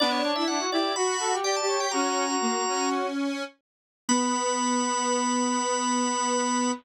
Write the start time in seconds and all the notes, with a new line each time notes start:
0.00 B3 D4 D5
0.11 C#5
0.24 D4 C#5
0.36 E4 E5
0.48 D4 F#5
0.59 F#4
0.72 E4 G4 D5
0.96 F#4 B5
1.20 A4
1.32 G4
1.43 G4 D5 G5
1.56 A5
1.62 G4
1.67 C#5
1.78 G4 G5
1.91 C#4 F#4 A#5
2.28 F#4
2.41 A#3
2.67 C#4
4.09 B3 B4 B5